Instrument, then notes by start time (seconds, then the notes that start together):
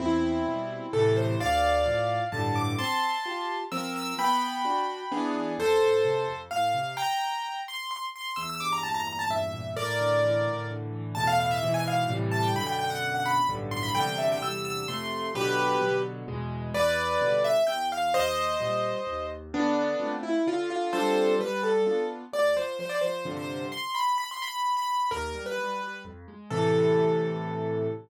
acoustic grand piano
0.00 E2 C4 E4
0.47 B2 G3
0.93 A2 C3 E3 A4
1.16 C5
1.40 D2 D5 F5
1.86 A2 F3
2.32 G2 A2 D3 A5
2.56 D6
2.78 C4 A5 C6
3.26 F4 G4
3.72 F3 C4 A#4 E6
3.96 E6
4.19 B3 G5 B5
4.65 D4 F#4
5.12 E3 B3 D4 G#4
5.58 F2 A4 C5
5.81 A2
6.05 C3
6.28 F2
6.51 A2 F5
6.74 C3
6.97 G5 A#5
7.68 C6
7.91 C6
8.16 C6
8.36 E2 E6
8.50 E6
8.60 G2 D6
8.72 A#5
8.83 A#2 A5
8.94 A#5
9.07 E2 A#5
9.19 A5
9.30 G2 E5
9.53 A#2
9.76 A2 A#4 D5
10.00 D3
10.23 E3
10.46 A2
10.70 D3
10.93 E3
11.15 E2 A2 B2 A5
11.27 F5
11.40 F5
11.51 E5
11.63 G#2 B2 E3
11.74 G#5
11.88 F5
12.09 A2 C3 E3 G3
12.31 A5
12.43 G5
12.56 F#2 B2 D3 B5
12.67 G5
12.79 G5
12.90 F#5
13.15 F#5
13.26 B5
13.49 B1 G2 A2 D3
13.71 C6
13.83 B5
13.95 E2 C3 D3 G3 G5
14.18 E5
14.32 G5
14.42 E2 C3 D3 G3 E6
14.65 E6
14.88 F2 C3 A3 C6
15.35 B2 D3 F#3 G4 B4
15.81 B2 D3 F#3
16.28 E2 B2 G#3
16.74 E2 B4 D5
17.21 B2 D3 G3
17.44 E5
17.67 E2 G5
17.92 F5
18.14 D#2 C5 D#5
18.60 A#2 G3
19.07 D#2
19.53 D3 B3 D4
20.00 A3 C4 F4
20.23 E4
20.47 D3 F4
20.70 F4
20.93 G3 C4 D4 F4 A4 C5
21.40 G3 B4
21.63 A4
21.86 B3 D4 F4
22.33 D2 D5
22.56 F3 C5
22.79 F3 C5
22.89 D5
23.01 F3 C5
23.25 G2 C3 D3 F3
23.37 C5
23.72 C6
23.95 B5
24.18 B5
24.31 C6
24.42 B5
24.77 B5
25.11 D#2 A#4
25.35 G3
25.46 B4
25.58 G3
25.81 G3
26.05 F2
26.28 G#3
26.50 A2 C3 E3 A4